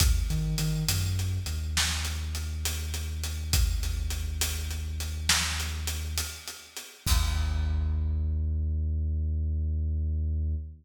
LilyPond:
<<
  \new Staff \with { instrumentName = "Synth Bass 2" } { \clef bass \time 12/8 \key ees \major \tempo 4. = 68 ees,8 ees8 ees8 ges,4 ees,2.~ ees,8~ | ees,1. | ees,1. | }
  \new DrumStaff \with { instrumentName = "Drums" } \drummode { \time 12/8 <hh bd>8 hh8 hh8 hh8 hh8 hh8 sn8 hh8 hh8 hh8 hh8 hh8 | <hh bd>8 hh8 hh8 hh8 hh8 hh8 sn8 hh8 hh8 hh8 hh8 hh8 | <cymc bd>4. r4. r4. r4. | }
>>